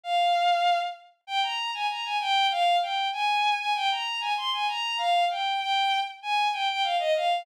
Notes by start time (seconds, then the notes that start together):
0.03 F5
1.27 G5
1.43 A#5
1.74 G#5
1.89 A#5
2.05 G#5
2.21 G5
2.51 F5
2.82 G5
3.13 G#5
3.58 G#5
3.75 G5
3.91 A#5
4.21 G#5
4.37 C6
4.53 G#5
4.68 A#5
4.98 F5
5.30 G5
5.60 G5
6.22 G#5
6.53 G5
6.70 G5
6.83 F5
6.99 D#5
7.16 F5